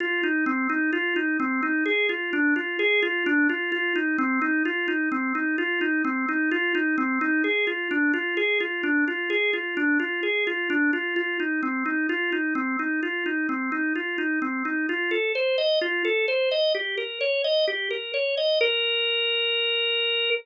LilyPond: \new Staff { \time 4/4 \key f \major \tempo 4 = 129 f'8 ees'8 c'8 ees'8 f'8 ees'8 c'8 ees'8 | aes'8 f'8 d'8 f'8 aes'8 f'8 d'8 f'8 | f'8 ees'8 c'8 ees'8 f'8 ees'8 c'8 ees'8 | f'8 ees'8 c'8 ees'8 f'8 ees'8 c'8 ees'8 |
aes'8 f'8 d'8 f'8 aes'8 f'8 d'8 f'8 | aes'8 f'8 d'8 f'8 aes'8 f'8 d'8 f'8 | f'8 ees'8 c'8 ees'8 f'8 ees'8 c'8 ees'8 | f'8 ees'8 c'8 ees'8 f'8 ees'8 c'8 ees'8 |
\key bes \major f'8 a'8 c''8 ees''8 f'8 a'8 c''8 ees''8 | g'8 bes'8 des''8 ees''8 g'8 bes'8 des''8 ees''8 | bes'1 | }